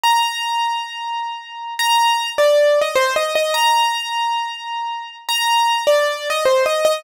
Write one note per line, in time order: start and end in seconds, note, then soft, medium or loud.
0.03 1.74 A#5 loud
1.79 2.30 A#5 loud
2.38 2.79 D5 loud
2.81 2.95 D#5 medium
2.95 3.14 C5 loud
3.16 3.34 D#5 loud
3.35 3.54 D#5 loud
3.54 5.16 A#5 loud
5.29 5.83 A#5 loud
5.87 6.28 D5 loud
6.30 6.44 D#5 loud
6.45 6.64 C5 loud
6.66 6.84 D#5 loud
6.85 7.03 D#5 loud